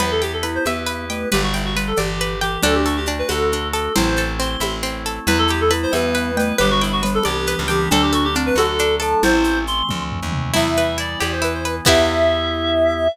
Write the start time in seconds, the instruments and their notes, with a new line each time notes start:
0.00 electric bass (finger) E2, drawbar organ B3 E4 G4, glockenspiel E4, clarinet B4, pizzicato strings B4, cowbell, low conga, shaker
0.11 clarinet A4
0.22 clarinet G4, pizzicato strings G5, shaker
0.33 clarinet A4
0.43 glockenspiel E4, pizzicato strings B4, shaker
0.55 clarinet C5
0.65 electric bass (finger) E2, glockenspiel B3, clarinet B4, pizzicato strings E5, cowbell, high conga, shaker
0.86 pizzicato strings B4, shaker
1.10 glockenspiel A3, clarinet B4, pizzicato strings G5, shaker
1.32 electric bass (finger) G1, glockenspiel G3, clarinet G4, pizzicato strings B4, cowbell, low conga, shaker
1.43 clarinet F#4
1.54 clarinet E4, pizzicato strings G5, shaker
1.65 clarinet F#4
1.76 glockenspiel G3, pizzicato strings B4, shaker
1.87 clarinet A4
1.96 electric bass (finger) G1, glockenspiel E3, clarinet G4, pizzicato strings D5, cowbell, high conga, shaker
2.21 pizzicato strings B4, shaker
2.41 glockenspiel E3, clarinet G4, pizzicato strings G5, shaker
2.62 electric bass (finger) D2, drawbar organ A3 D4 F#4, pizzicato strings D4, glockenspiel D4, clarinet A4, cowbell, low conga, shaker
2.75 clarinet G4
2.86 clarinet F#4, pizzicato strings A4, shaker
2.97 clarinet G4
3.06 glockenspiel D4, pizzicato strings D4, shaker
3.19 clarinet B4
3.28 electric bass (finger) D2, pizzicato strings F#4, glockenspiel F#4, clarinet A4, cowbell, high conga, shaker
3.52 pizzicato strings D4, shaker
3.73 pizzicato strings A4, clarinet A4, glockenspiel A4, shaker
3.96 electric bass (finger) A1, drawbar organ A3 C4 E4, pizzicato strings C4, glockenspiel E4, clarinet C5, cowbell, low conga, shaker
4.16 pizzicato strings A4, shaker
4.40 pizzicato strings C4, clarinet C6, shaker
4.60 electric bass (finger) A1, pizzicato strings E4, cowbell, high conga, shaker
4.83 pizzicato strings C4, shaker
5.06 pizzicato strings A4, shaker
5.27 electric bass (finger) E2, drawbar organ G3 B3 E4, glockenspiel E4, clarinet B4, pizzicato strings B4, cowbell, low conga, shaker
5.38 clarinet A4
5.48 clarinet G4, pizzicato strings G5, shaker
5.61 clarinet A4
5.71 glockenspiel E4, pizzicato strings B4, shaker
5.83 clarinet C5
5.92 electric bass (finger) E2, glockenspiel B3, clarinet B4, pizzicato strings E5, cowbell, high conga, shaker
6.15 pizzicato strings B4, shaker
6.37 glockenspiel A3, clarinet B4, pizzicato strings G5, shaker
6.58 electric bass (finger) G1, glockenspiel G3, drawbar organ G3 B3 D4, clarinet G4, pizzicato strings B4, cowbell, low conga, shaker
6.71 clarinet F#4
6.81 clarinet E4, pizzicato strings G5, shaker
6.92 clarinet F#4
7.03 glockenspiel G3, pizzicato strings B4, shaker
7.14 clarinet A4
7.23 electric bass (finger) C2, glockenspiel E3, clarinet G4, pizzicato strings D5, cowbell, high conga, shaker
7.47 pizzicato strings B4, shaker
7.59 electric bass (finger) C#2
7.68 glockenspiel E3, clarinet G4, pizzicato strings G5, shaker
7.91 electric bass (finger) D2, drawbar organ F#3 A3 D4, glockenspiel D4, pizzicato strings D4, clarinet A4, cowbell, low conga, shaker
8.02 clarinet G4
8.12 clarinet F#4, pizzicato strings A4, shaker
8.24 clarinet G4
8.35 glockenspiel C4, pizzicato strings D4, shaker
8.46 clarinet B4
8.55 electric bass (finger) D2, glockenspiel F#4, pizzicato strings F#4, clarinet A4, cowbell, high conga, shaker
8.79 pizzicato strings D4, shaker
9.00 pizzicato strings A4, glockenspiel A4, clarinet A5, shaker
9.23 electric bass (finger) A1, drawbar organ E3 A3 C4, glockenspiel E4, clarinet C5, cowbell, low conga, shaker
9.44 shaker
9.67 clarinet C6, shaker
9.89 electric bass (finger) D2, kick, high tom
10.12 floor tom
10.23 electric bass (finger) D#2
10.32 mid tom
10.53 electric bass (finger) E2, drawbar organ E3 G3 B3, pizzicato strings E4, glockenspiel E4, clarinet E5, crash, cowbell, low conga, shaker
10.77 pizzicato strings B4, shaker
10.98 pizzicato strings E4, clarinet D5, shaker
11.20 electric bass (finger) E2, drawbar organ E3 B3 E4, pizzicato strings G4, clarinet D5, cowbell, high conga, shaker
11.32 clarinet C5
11.42 pizzicato strings E4, clarinet B4, shaker
11.54 clarinet C5
11.65 clarinet B4, pizzicato strings B4, shaker
11.85 electric bass (finger) E2, pizzicato strings B3 E4 G4, drawbar organ B3 E4 G4, glockenspiel E4, clarinet E5, kick, crash